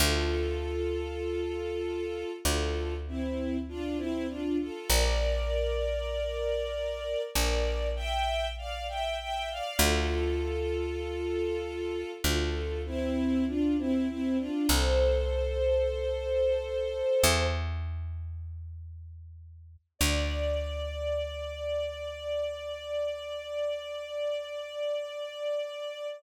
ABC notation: X:1
M:4/4
L:1/16
Q:1/4=49
K:Dm
V:1 name="String Ensemble 1"
[FA]8 [FA]2 [CE]2 [DF] [CE] [DF] [FA] | [Bd]8 [Bd]2 [eg]2 [df] [eg] [eg] [df] | [FA]8 [FA]2 [CE]2 [DF] [CE] [CE] [DF] | "^rit." [Ac]10 z6 |
d16 |]
V:2 name="Electric Bass (finger)" clef=bass
D,,8 D,,8 | B,,,8 B,,,8 | D,,8 D,,8 | "^rit." C,,8 E,,8 |
D,,16 |]